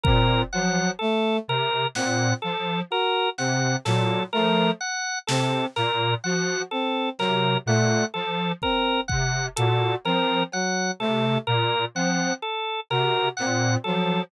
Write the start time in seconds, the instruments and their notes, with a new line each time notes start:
0.04 lead 1 (square) A#2, brass section C4, drawbar organ A#4, kick
0.53 lead 1 (square) F3, brass section F#3, drawbar organ F#5
0.99 brass section A3, drawbar organ A4
1.48 lead 1 (square) C3, drawbar organ A#4
1.95 lead 1 (square) A#2, brass section C4, drawbar organ F#5, snare
2.42 lead 1 (square) F3, drawbar organ A4
2.90 brass section F#4, drawbar organ A#4
3.38 lead 1 (square) C3, brass section C4, drawbar organ F#5, snare
3.85 lead 1 (square) A#2, brass section F#3, drawbar organ A4, snare
4.33 lead 1 (square) F3, brass section A3, drawbar organ A#4
4.81 drawbar organ F#5
5.27 lead 1 (square) C3, brass section C4, drawbar organ A4, snare
5.76 lead 1 (square) A#2, drawbar organ A#4, snare
6.24 lead 1 (square) F3, brass section F#4, drawbar organ F#5
6.71 brass section C4, drawbar organ A4
7.19 lead 1 (square) C3, brass section F#3, drawbar organ A#4, clap
7.66 lead 1 (square) A#2, brass section A3, drawbar organ F#5
8.14 lead 1 (square) F3, drawbar organ A4
8.62 brass section C4, drawbar organ A#4, kick
9.08 lead 1 (square) C3, drawbar organ F#5, kick
9.56 lead 1 (square) A#2, brass section F#4, drawbar organ A4, closed hi-hat
10.05 lead 1 (square) F3, brass section C4, drawbar organ A#4, cowbell
10.52 brass section F#3, drawbar organ F#5, cowbell
10.99 lead 1 (square) C3, brass section A3, drawbar organ A4
11.47 lead 1 (square) A#2, drawbar organ A#4
11.95 lead 1 (square) F3, brass section C4, drawbar organ F#5
12.42 drawbar organ A4
12.90 lead 1 (square) C3, brass section F#4, drawbar organ A#4, cowbell
13.37 lead 1 (square) A#2, brass section C4, drawbar organ F#5, clap
13.84 lead 1 (square) F3, brass section F#3, drawbar organ A4